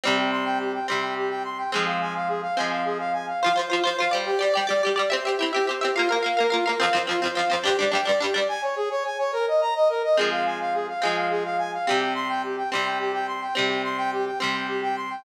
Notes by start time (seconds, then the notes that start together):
0.04 C3 G3 C4 G4
0.18 G5
0.32 C6
0.46 G5
0.59 G4
0.74 G5
0.88 C3 G3 C4 C6
1.02 G5
1.16 G4
1.30 G5
1.45 C6
1.58 G5
1.72 F3 G#3 C4 G#4
1.86 F5
2.01 G#5
2.15 F5
2.28 G#4
2.42 F5
2.57 F3 G#3 C4 G#5
2.71 F5
2.85 G#4
2.99 F5
3.13 G#5
3.27 F5
3.42 F4 C5 F5
3.46 F3
3.56 F3 F4 C5
3.70 F3 F4 C5
3.84 F3 F4 C5
3.98 F4 C5 F5
4.02 F3
4.11 G3 G4 C5 D5
4.26 G4
4.39 G3 G4 D5
4.54 G3 G4 D5 G5
4.67 G3 G4 D5
4.82 G4 D5
4.87 G3
4.96 G3 G4 D5
5.10 C4 G4 C5 E5
5.24 G4 E5
5.29 C4
5.39 C4 E4 G4 E5
5.53 C4 G4 E5
5.67 C4 G4 C5 E5
5.81 C4 G4 E5
5.95 A#3 F4 A#4 F5
6.09 A#3 A#4 F5
6.23 A#3 A#4 F5
6.37 A#3 A#4 F5
6.50 A#3 F4 A#4 F5
6.65 A#3 A#4 F5
6.80 F2 F3 C4 F5
6.93 F2 F3 C4 C5
7.07 F2 F3 C4 F4
7.22 F2 F3 C4 C5
7.35 F2 F3 C4 F5
7.50 F2 F3 C4 C5
7.64 G2 G3 D4 G4
7.79 G2 G3 D4 D5
7.92 G2 G3 D4 G5
8.05 G2 G3 D4 D5
8.20 G2 G3 D4 G4
8.34 G2 G3 D4 D5
8.48 G#5
8.62 C#5
8.76 G#4
8.90 C#5
9.05 G#5
9.18 C#5
9.33 A#4
9.48 D#5
9.61 A#5
9.75 D#5
9.89 A#4
10.04 D#5
10.17 F3 G#3 C4 G#4
10.31 F5
10.45 G#5
10.60 F5
10.74 G#4
10.88 F5
11.02 F3 G#3 C4 G#5
11.16 F5
11.30 G#4
11.44 F5
11.58 G#5
11.73 F5
11.87 C3 G3 C4 G4
12.01 G5
12.15 C6
12.29 G5
12.43 G4
12.57 G5
12.71 C3 G3 C4 C6
12.86 G5
12.99 G4
13.14 G5
13.27 C6
13.42 G5
13.55 C3 G3 C4 G4
13.69 G5
13.84 C6
13.98 G5
14.12 G4
14.26 G5
14.39 C3 G3 C4 C6
14.54 G5
14.68 G4
14.83 G5
14.96 C6
15.10 G5